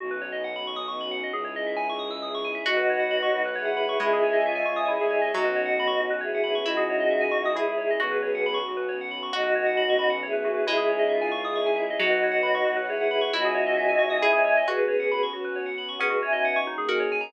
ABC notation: X:1
M:6/8
L:1/16
Q:3/8=90
K:Bmix
V:1 name="Choir Aahs"
z12 | z12 | [DF]8 [EG]4 | [EG]4 =F4 [EG]4 |
[DF]8 [EG]4 | [DF]8 [EG]4 | [GB]6 z6 | [DF]8 [EG]4 |
[EG]4 =F4 [EG]4 | [DF]8 [EG]4 | [DF]8 [eg]4 | [GB]6 z6 |
[GB]2 [eg]4 z6 |]
V:2 name="Harpsichord"
z12 | z12 | F12 | G,10 z2 |
F,12 | E8 G4 | F4 z8 | F12 |
G,10 z2 | F,6 z6 | E8 G4 | F4 z8 |
C8 F4 |]
V:3 name="Tubular Bells"
F B c d f b c' d' c' b f d | G c d e g c' d' e' d' c' g e | F B c f b c' F B c f b c' | E G c d e g c' d' E G c d |
F B c f b c' F B c f b c' | E G c d e g c' d' E G c d | F B c f b c' F B c f b c' | F B c f b c' b f c B F B |
E G c d e g c' d' c' g e d | F B c f b c' F B c f b c' | E G c d e g c' d' E G c d | F B c f b c' F B c f b c' |
B, F c d f c' D G ^A c g ^a |]
V:4 name="Violin" clef=bass
B,,,12 | C,,12 | B,,,6 B,,,6 | C,,6 C,,3 =C,,3 |
B,,,6 B,,,6 | C,,6 C,,6 | B,,,6 B,,,6 | B,,,12 |
C,,12 | B,,,6 B,,,6 | C,,6 C,,6 | z12 |
z12 |]
V:5 name="String Ensemble 1"
[B,CDF]12 | [CDEG]12 | [Bcf]12 | [cdeg]12 |
[B,CF]12 | [CDEG]12 | [B,CF]12 | [B,CF]12 |
[CDEG]12 | [Bcf]12 | [cdeg]12 | [B,CF]12 |
[B,CDF]6 [D,^A,CG]6 |]